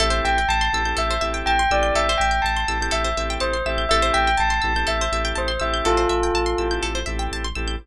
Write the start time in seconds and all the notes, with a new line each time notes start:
0.00 A1 C4 E4 G4 A4 E5
0.10 C5
0.24 A1 E5 G5
0.38 G5
0.49 A1 A5
0.61 C6
0.73 A1 C4 E4 G4 A4 E6
0.85 C4 E4 G4 A4 G6
0.97 A1 A4 E5
1.11 C5
1.21 A1 C4 E4 G4 A4 E5
1.34 G5
1.46 A1 G5 A5
1.59 C6
1.71 A1 C4 E4 G4 A4 D5 E6
1.83 G6
1.95 A1 A4 E5
2.09 C5
2.18 A1 E5 G5
2.31 G5
2.42 A1 A5
2.57 C6
2.68 A1 C4 E4 G4 A4 E6
2.80 C4 E4 G4 A4 G6
2.91 A1 A4 E5
3.04 C5
3.17 A1 C4 E4 G4 A4 E5
3.30 G5
3.40 A1 C5 A5
3.53 C6
3.66 A1 C4 E4 G4 A4 E5 E6
3.78 G6
3.89 A1 C4 E4 G4 A4 E5
4.02 C5
4.14 A1 E5 G5
4.27 G5
4.38 A1 A5
4.50 C6
4.62 A1 C4 E4 G4 A4 E6
4.76 C4 E4 G4 A4 G6
4.87 A1 A4 E5
5.01 C5
5.12 A1 C4 E4 G4 A4 E5
5.25 G5
5.35 A1 C5 A5
5.48 C6
5.60 A1 C4 E4 G4 A4 E5 E6
5.74 G6
5.85 A1 F4 A4
5.97 C5
6.09 A1 E5
6.23 G5
6.34 A1 A5
6.46 C6
6.58 A1 C4 E4 G4 A4 E6
6.71 C4 E4 G4 A4 G6
6.83 A1 A4
6.95 C5
7.06 A1 C4 E4 G4 A4 E5
7.19 G5
7.32 A1 A5
7.44 C6
7.55 A1 C4 E4 G4 A4 E6
7.68 G6